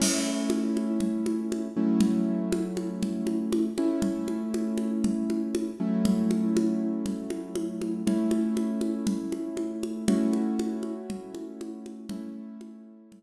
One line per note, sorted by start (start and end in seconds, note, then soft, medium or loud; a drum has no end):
0.00 1.68 A3 medium
0.00 1.68 C#4 medium
0.00 1.68 E4 medium
0.00 crash loud
0.00 low conga medium
0.50 high conga medium
0.77 high conga medium
1.00 low conga medium
1.26 high conga medium
1.52 high conga medium
1.76 3.68 F#3 medium
1.76 3.68 A3 medium
1.76 3.68 C#4 medium
1.76 3.68 E4 medium
2.01 low conga medium
2.52 high conga medium
2.77 high conga medium
3.03 low conga medium
3.27 high conga medium
3.53 high conga medium
3.78 5.70 A3 medium
3.78 5.70 C#4 medium
3.78 5.70 E4 medium
3.78 high conga medium
4.02 low conga medium
4.28 high conga medium
4.54 high conga medium
4.78 high conga medium
5.04 low conga medium
5.30 high conga medium
5.55 high conga medium
5.80 8.03 F#3 medium
5.80 8.03 A3 medium
5.80 8.03 C#4 medium
5.80 8.03 E4 medium
6.05 low conga loud
6.31 high conga medium
6.57 high conga medium
7.06 low conga medium
7.30 high conga medium
7.55 high conga medium
7.82 high conga medium
8.07 10.04 A3 medium
8.07 10.04 C#4 medium
8.07 10.04 E4 medium
8.07 low conga medium
8.31 high conga medium
8.57 high conga medium
8.81 high conga medium
9.07 low conga medium
9.32 high conga medium
9.57 high conga medium
9.83 high conga medium
10.08 12.06 A3 medium
10.08 12.06 C#4 medium
10.08 12.06 E4 medium
10.08 12.06 F#4 medium
10.08 low conga loud
10.33 high conga medium
10.59 high conga medium
10.83 high conga medium
11.10 low conga medium
11.35 high conga medium
11.61 high conga medium
11.86 high conga medium
12.09 13.23 A3 medium
12.09 13.23 C#4 medium
12.09 13.23 E4 medium
12.09 low conga loud
12.61 high conga medium
13.12 low conga medium